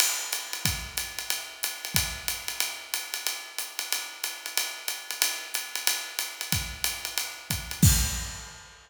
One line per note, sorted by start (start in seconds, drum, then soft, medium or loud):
0.00 crash medium
0.00 ride loud
0.33 hi-hat pedal medium
0.33 ride medium
0.53 ride medium
0.65 kick medium
0.65 ride medium
0.97 hi-hat pedal medium
0.97 ride medium
1.19 ride medium
1.30 ride medium
1.63 hi-hat pedal medium
1.63 ride medium
1.85 ride medium
1.94 kick medium
1.94 ride loud
2.28 hi-hat pedal medium
2.28 ride medium
2.48 ride medium
2.60 ride medium
2.94 hi-hat pedal medium
2.94 ride medium
3.14 ride medium
3.27 ride medium
3.58 hi-hat pedal medium
3.58 ride medium
3.79 ride medium
3.92 ride medium
4.24 hi-hat pedal medium
4.24 ride medium
4.46 ride medium
4.57 ride medium
4.88 hi-hat pedal medium
4.88 ride medium
5.11 ride medium
5.22 ride loud
5.54 hi-hat pedal medium
5.54 ride medium
5.75 ride medium
5.87 ride loud
6.19 hi-hat pedal medium
6.19 ride medium
6.41 ride medium
6.52 kick medium
6.52 ride medium
6.84 hi-hat pedal medium
6.84 ride medium
7.05 ride medium
7.18 ride medium
7.50 kick medium
7.50 hi-hat pedal medium
7.50 ride medium
7.71 ride medium
7.83 kick loud
7.83 crash loud